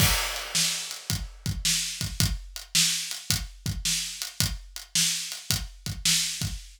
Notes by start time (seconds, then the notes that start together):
0.00 kick, crash
0.36 closed hi-hat
0.55 snare
0.91 closed hi-hat
1.10 kick, closed hi-hat
1.46 kick, closed hi-hat
1.65 snare
2.01 kick, closed hi-hat
2.20 kick, closed hi-hat
2.56 closed hi-hat
2.75 snare
3.11 closed hi-hat
3.30 kick, closed hi-hat
3.66 kick, closed hi-hat
3.85 snare
4.22 closed hi-hat
4.40 kick, closed hi-hat
4.76 closed hi-hat
4.95 snare
5.32 closed hi-hat
5.50 kick, closed hi-hat
5.86 kick, closed hi-hat
6.05 snare
6.41 kick, closed hi-hat